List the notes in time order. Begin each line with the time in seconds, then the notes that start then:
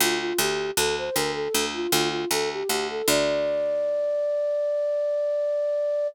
0.00 D2 F4
0.20 F4
0.38 D2 G4
0.77 D2 A4
0.98 C5
1.13 D2 A#4
1.34 A4
1.54 D2
1.74 F4
1.91 D2 F4
2.10 F4
2.31 D2 A4
2.52 G4
2.69 D2 G4
2.90 A4
3.07 D2 D5